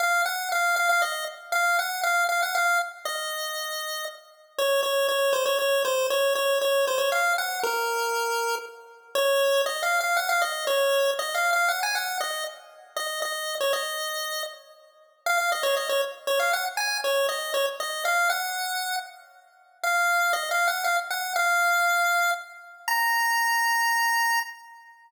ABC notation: X:1
M:3/4
L:1/16
Q:1/4=118
K:Bbm
V:1 name="Lead 1 (square)"
f2 g2 f2 f f e2 z2 | f2 g2 f2 f g f2 z2 | e8 z4 | d2 d2 d2 c d d2 c2 |
d2 d2 d2 c d f2 g2 | B8 z4 | d4 (3e2 f2 f2 g f e2 | d4 (3e2 f2 f2 g a g2 |
e2 z4 e2 e3 d | e6 z6 | f f e d e d z2 d f g z | a2 d2 e2 d z e2 f2 |
g6 z6 | f4 (3e2 f2 g2 f z g2 | f8 z4 | b12 |]